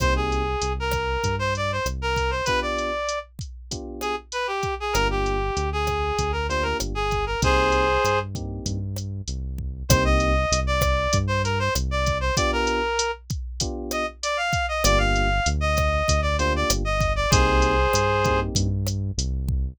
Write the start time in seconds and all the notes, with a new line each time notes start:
0.00 C2 A#3 C4 D#4 G4 C5, kick, cross-stick, closed hi-hat
0.16 G#4
0.32 closed hi-hat
0.62 C2, closed hi-hat
0.80 A#4
0.91 kick, cross-stick, closed hi-hat
1.24 G2, kick, closed hi-hat
1.39 C5
1.55 D5, closed hi-hat
1.72 C5
1.86 C2, cross-stick, closed hi-hat
2.02 A#4
2.16 kick, closed hi-hat
2.31 C5
2.45 B3 D4 F4 G4 B4, kick, closed hi-hat
2.62 D5
2.78 closed hi-hat
3.09 closed hi-hat
3.39 kick, closed hi-hat
3.71 B3 D4 F4 G4, kick, closed hi-hat
4.01 G#4, cross-stick, closed hi-hat
4.32 B4, closed hi-hat
4.47 G4
4.63 kick, closed hi-hat
4.80 G#4
4.93 G1 A#3 D4 F4 G4 A#4, cross-stick, closed hi-hat
5.11 G4
5.26 closed hi-hat
5.57 D2, closed hi-hat
5.73 G#4
5.87 kick, cross-stick, closed hi-hat
6.19 D2, kick, closed hi-hat
6.32 A#4
6.49 A#3 D4 F4 G4 C5, closed hi-hat
6.63 A#4
6.80 G1, cross-stick, closed hi-hat
6.95 G#4
7.11 kick, closed hi-hat
7.26 A#4
7.42 C2 A#3 C4 D#4 G4 G#4 C5, kick, closed hi-hat
7.72 closed hi-hat
8.04 G2, cross-stick, closed hi-hat
8.35 A#3 C4 D#4 G4, kick, closed hi-hat
8.66 G2, kick, closed hi-hat
8.96 cross-stick, closed hi-hat
9.28 C2, closed hi-hat
9.58 kick
9.89 C2 A#3 C4 D#4 G4 C5, kick, cross-stick, closed hi-hat
10.05 D#5
10.20 closed hi-hat
10.52 C2, closed hi-hat
10.67 D5
10.81 kick, cross-stick, closed hi-hat
11.13 G2, kick, closed hi-hat
11.27 C5
11.44 A#4, closed hi-hat
11.59 C5
11.75 C2, cross-stick, closed hi-hat
11.91 D5
12.06 kick, closed hi-hat
12.20 C5
12.36 B3 D4 F4 G4 D5, kick, closed hi-hat
12.53 A#4
12.67 closed hi-hat
12.99 closed hi-hat
13.30 kick, closed hi-hat
13.60 B3 D4 F4 G4, kick, closed hi-hat
13.91 D#5, cross-stick, closed hi-hat
14.23 D5, closed hi-hat
14.37 F5
14.53 kick, closed hi-hat
14.68 D#5
14.84 G1 A#3 D4 F4 G4 D5, cross-stick, closed hi-hat
14.98 F5
15.16 closed hi-hat
15.46 D2, closed hi-hat
15.61 D#5
15.77 kick, cross-stick, closed hi-hat
16.08 D2, kick, closed hi-hat
16.22 D5
16.38 A#3 D4 F4 G4 C5, closed hi-hat
16.56 D5
16.70 G1, cross-stick, closed hi-hat
16.85 D#5
17.01 kick, closed hi-hat
17.16 D5
17.30 C2 A#3 C4 D#4 G4 G#4 C5, kick, closed hi-hat
17.62 closed hi-hat
17.93 G2, cross-stick, closed hi-hat
18.24 A#3 C4 D#4 G4, kick, closed hi-hat
18.55 G2, kick, closed hi-hat
18.87 cross-stick, closed hi-hat
19.18 C2, closed hi-hat
19.48 kick